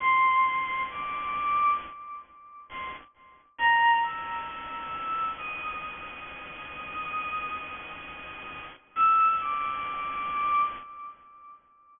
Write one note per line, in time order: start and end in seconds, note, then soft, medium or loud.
0.00 0.81 C6 loud
0.89 1.70 D6 medium
2.69 2.89 C6 medium
3.58 3.99 A#5 loud
4.03 5.24 E6 medium
5.37 8.60 D#6 medium
8.96 9.36 E6 loud
9.40 10.61 D6 medium